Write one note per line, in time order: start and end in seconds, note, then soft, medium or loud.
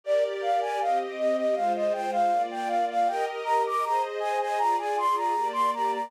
0.04 0.79 G4 medium
0.04 0.79 A#4 medium
0.04 0.79 D5 medium
0.04 0.24 D5 loud
0.42 0.60 F5 medium
0.61 0.79 G#5 loud
0.80 1.55 C4 medium
0.80 1.55 G4 medium
0.80 1.55 D#5 medium
0.80 0.99 F5 medium
1.19 1.37 D#5 loud
1.37 1.55 D#5 medium
1.55 2.31 G#3 medium
1.55 2.31 F4 medium
1.55 2.31 C5 medium
1.55 1.73 F5 medium
1.75 1.93 D#5 medium
1.93 2.11 G5 loud
2.12 2.43 F5 loud
2.31 3.07 A#3 medium
2.31 3.07 F4 medium
2.31 3.07 D5 medium
2.51 2.69 G5 medium
2.67 2.85 F5 medium
2.90 3.08 F5 loud
3.07 3.83 G4 medium
3.07 3.83 A#4 loud
3.07 3.83 D#5 medium
3.07 3.25 G5 loud
3.45 3.63 A#5 loud
3.67 3.85 D6 loud
3.83 4.58 G#4 medium
3.83 4.58 C5 medium
3.83 4.58 D#5 medium
3.83 4.02 A#5 loud
4.20 4.38 G#5 loud
4.41 4.59 G#5 loud
4.58 5.34 F4 medium
4.58 5.34 G#4 medium
4.58 5.34 D5 medium
4.58 4.76 A#5 loud
4.78 4.96 G#5 loud
4.98 5.16 C6 loud
5.16 5.48 A#5 medium
5.35 6.11 A#3 medium
5.35 6.11 G4 medium
5.35 6.11 D5 medium
5.53 5.71 C6 loud
5.74 5.92 A#5 medium
5.94 6.11 A#5 medium